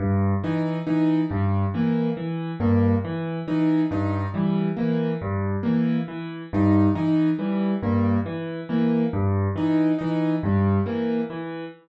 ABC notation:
X:1
M:9/8
L:1/8
Q:3/8=46
K:none
V:1 name="Acoustic Grand Piano" clef=bass
G,, E, E, G,, E, E, G,, E, E, | G,, E, E, G,, E, E, G,, E, E, | G,, E, E, G,, E, E, G,, E, E, |]
V:2 name="Acoustic Grand Piano"
z ^D D G, ^A, z A, z D | ^D G, ^A, z A, z D D G, | ^A, z A, z ^D D G, A, z |]